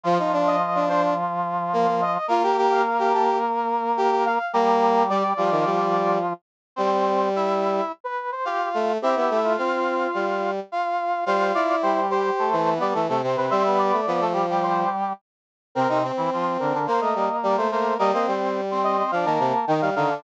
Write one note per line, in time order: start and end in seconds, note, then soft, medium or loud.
0.04 2.18 F3 medium
0.04 0.18 F3 loud
0.04 2.18 F4 medium
0.19 0.32 D#4 medium
0.33 0.56 D4 loud
0.47 0.83 D#5 medium
0.75 0.88 D4 medium
0.89 1.14 D4 loud
0.89 1.02 C5 medium
1.73 1.86 A#3 loud
1.87 2.01 A#3 medium
2.01 2.27 D#5 medium
2.28 4.39 A#3 medium
2.28 2.42 F4 loud
2.28 4.39 A#4 loud
2.43 2.56 G4 loud
2.57 2.82 G4 loud
2.71 3.09 F5 medium
2.99 3.12 G4 loud
3.13 3.38 G4 medium
3.13 3.27 A5 medium
3.97 4.10 G4 loud
4.11 4.25 G4 medium
4.25 4.52 F5 medium
4.53 5.34 G3 medium
4.53 5.03 A#3 loud
4.53 5.34 G4 medium
4.53 5.06 A#5 medium
5.09 5.23 G3 loud
5.09 6.17 D5 medium
5.37 6.33 F3 medium
5.37 5.51 G3 medium
5.37 6.33 F4 medium
5.51 5.65 D#3 medium
5.65 6.18 G3 medium
6.76 7.81 G3 loud
6.76 7.29 C4 medium
6.76 7.29 C5 medium
7.36 7.92 E4 medium
7.36 7.92 E5 medium
8.04 8.31 B4 medium
8.32 8.45 C5 medium
8.45 8.92 F4 medium
8.45 8.69 G4 medium
8.45 8.92 F5 medium
8.74 8.98 A3 medium
9.02 9.15 C4 loud
9.02 9.52 E4 medium
9.02 9.38 G4 medium
9.02 9.52 E5 medium
9.16 9.29 B3 medium
9.30 9.56 A3 medium
9.44 10.26 F4 medium
9.57 10.07 C4 medium
9.57 10.51 F4 medium
9.57 10.51 F5 medium
10.14 10.60 G3 medium
10.72 11.24 F4 medium
10.72 11.24 F5 medium
11.26 11.52 G3 loud
11.26 11.76 F4 medium
11.26 11.52 C5 medium
11.26 11.76 F5 medium
11.54 12.00 E4 medium
11.54 11.68 D5 medium
11.68 11.82 D5 medium
11.82 12.31 G3 medium
11.82 12.31 G4 medium
11.82 12.06 C5 medium
12.10 12.49 G4 medium
12.10 12.70 C5 medium
12.39 12.56 A3 medium
12.39 12.56 A4 medium
12.52 12.79 E3 medium
12.52 12.74 A3 medium
12.52 12.74 A4 medium
12.76 12.94 B3 medium
12.76 12.94 B4 medium
12.80 12.94 G3 medium
12.80 12.94 D5 medium
12.93 13.08 E3 medium
12.93 13.06 A3 medium
12.93 13.06 A4 medium
13.08 13.22 C3 medium
13.08 13.21 A3 medium
13.08 13.21 A4 medium
13.23 13.36 C3 medium
13.23 13.46 C4 medium
13.23 13.46 C5 medium
13.37 13.50 C3 medium
13.37 13.50 B4 medium
13.50 13.92 G3 loud
13.50 13.63 C4 medium
13.50 13.63 C5 medium
13.50 13.76 E5 medium
13.65 14.00 B3 medium
13.65 14.00 B4 medium
13.79 14.24 D5 medium
13.93 14.06 A3 medium
14.07 14.84 F3 medium
14.07 14.20 B3 medium
14.07 14.20 B4 medium
14.20 14.33 A3 medium
14.20 14.33 A4 medium
14.33 14.46 G3 medium
14.33 14.46 G4 medium
14.49 15.13 G3 medium
14.49 15.13 G4 medium
14.63 14.89 C5 medium
15.75 15.87 C3 medium
15.75 15.88 C4 medium
15.75 15.87 C4 medium
15.75 15.98 A#4 medium
15.88 16.12 C3 medium
15.88 16.12 C4 medium
15.88 16.03 D#4 medium
16.03 16.75 C4 medium
16.17 16.30 E3 medium
16.17 16.30 E4 medium
16.33 16.57 F3 medium
16.33 16.57 F4 medium
16.59 16.73 D3 medium
16.59 16.73 D4 medium
16.59 16.86 A#4 medium
16.74 16.87 D3 medium
16.74 16.87 D4 medium
16.87 17.00 A#3 medium
16.87 17.67 A#3 medium
16.87 17.67 A#4 medium
16.87 17.00 C5 medium
17.01 17.14 A3 medium
17.01 17.36 D#5 medium
17.15 17.28 G3 medium
17.43 17.56 G3 medium
17.43 17.56 D5 medium
17.57 17.70 A3 medium
17.57 17.71 C5 medium
17.71 17.94 A3 medium
17.71 17.97 A#3 medium
17.71 17.97 A#4 medium
17.71 17.95 C5 medium
17.98 18.12 G3 loud
17.98 18.11 A#3 medium
17.98 18.11 A#4 medium
17.98 18.27 D#5 medium
18.12 18.26 A#3 medium
18.12 18.61 C4 medium
18.12 18.61 C5 medium
18.27 19.02 G3 medium
18.71 18.97 C4 medium
18.71 18.97 C5 medium
18.83 19.10 D#5 medium
18.98 19.11 C4 medium
18.98 19.11 C5 medium
19.11 19.25 F3 medium
19.11 19.26 D4 medium
19.11 19.26 D5 medium
19.11 19.25 F5 medium
19.25 19.39 D#3 medium
19.25 19.65 A#3 medium
19.25 19.65 A#4 medium
19.25 19.66 A5 medium
19.39 19.53 C3 medium
19.67 19.81 D#3 medium
19.67 19.90 D#3 medium
19.67 19.90 D#4 medium
19.67 19.81 G5 medium
19.81 19.95 G3 medium
19.81 19.95 F5 medium
19.95 20.20 D3 medium
19.95 20.09 D#3 medium
19.95 20.09 D#4 medium
19.95 20.21 F5 medium
20.09 20.22 D3 medium
20.09 20.22 D4 medium